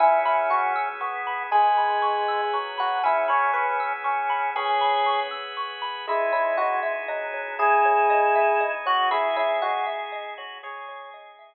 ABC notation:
X:1
M:6/8
L:1/8
Q:3/8=79
K:C#dor
V:1 name="Electric Piano 1"
E E F z3 | G5 F | E c B z3 | C3 z3 |
E E F z3 | G5 F | E E F z3 | c2 z4 |]
V:2 name="Drawbar Organ"
C4 B,2 | G,4 F,2 | C4 C2 | G3 z3 |
G,4 F,2 | E5 F | G5 F | G4 z2 |]
V:3 name="Xylophone"
g b c' e' c' b | g b c' e' c' b | g b c' e' c' b | g b c' e' c' b |
G c d e d c | G c d e d c | G c d e d c | G c d e z2 |]
V:4 name="Synth Bass 2" clef=bass
C,,6 | C,,6 | C,,6 | C,,6 |
C,,6- | C,,6 | C,,6- | C,,6 |]
V:5 name="Drawbar Organ"
[B,CEG]6 | [B,CGB]6 | [B,CEG]6 | [B,CGB]6 |
[CDEG]6 | [G,CDG]6 | [CDEG]6 | [G,CDG]6 |]